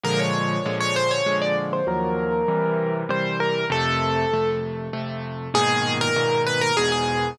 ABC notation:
X:1
M:3/4
L:1/16
Q:1/4=98
K:Bbm
V:1 name="Acoustic Grand Piano"
B d4 d c ^c2 =d z =c | B8 c2 B2 | =A6 z6 | [K:G#m] G3 A3 B A G G3 |]
V:2 name="Acoustic Grand Piano"
[B,,=D,F,A,]4 [B,,D,F,A,]4 [B,,D,F,A,]4 | [E,,F,G,B,]4 [C,=E,=G,]4 [C,E,G,]4 | [F,,C,=A,]4 [F,,C,A,]4 [F,,C,A,]4 | [K:G#m] [G,,A,,B,,D,]4 [G,,A,,B,,D,]4 [E,,G,,B,,]4 |]